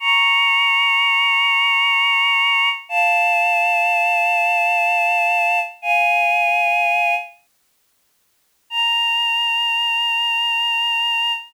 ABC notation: X:1
M:3/4
L:1/8
Q:1/4=62
K:Bbdor
V:1 name="Choir Aahs"
[bd']6 | [f=a]6 | [fa]3 z3 | b6 |]